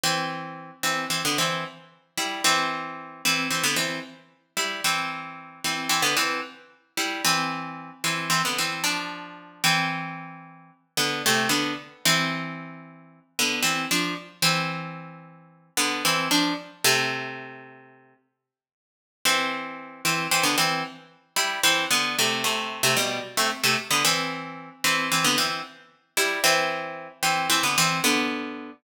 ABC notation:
X:1
M:9/8
L:1/16
Q:3/8=75
K:C
V:1 name="Pizzicato Strings"
[E,C]6 [E,C]2 [E,C] [D,B,] [E,C]2 z4 [G,E]2 | [E,C]6 [E,C]2 [E,C] [D,B,] [E,C]2 z4 [G,E]2 | [E,C]6 [E,C]2 [E,C] [D,B,] [E,C]2 z4 [G,E]2 | [E,C]6 [E,C]2 [E,C] [D,B,] [E,C]2 [F,D]6 |
[E,C]10 [D,B,]2 [C,A,]2 [D,B,]2 z2 | [E,C]10 [D,B,]2 [E,C]2 [F,D]2 z2 | [E,C]10 [D,B,]2 [E,C]2 [F,D]2 z2 | [C,A,]10 z8 |
[E,C]6 [E,C]2 [E,C] [D,B,] [E,C]2 z4 [G,E]2 | [E,C]2 [D,B,]2 [C,A,]2 [C,A,]3 [C,A,] [B,,G,]2 z [C,A,] z [C,A,] z [D,B,] | [E,C]6 [E,C]2 [E,C] [D,B,] [E,C]2 z4 [G,E]2 | [E,C]6 [E,C]2 [E,C] [D,B,] [E,C]2 [D,B,]6 |]